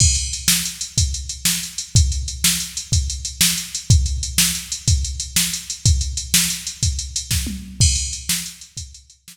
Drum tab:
CC |x-----------|------------|------------|------------|
HH |-xx-xxxxx-xx|xxx-xxxxx-xx|xxx-xxxxx-xx|xxx-xxxxx---|
SD |---o-----o--|---o-----o--|---o-----o--|---o-----o--|
T1 |------------|------------|------------|----------o-|
BD |o-----o-----|o-----o-----|o-----o-----|o-----o--o--|

CC |x-----------|
HH |-xx-xxxxx---|
SD |---o-----o--|
T1 |------------|
BD |o-----o-----|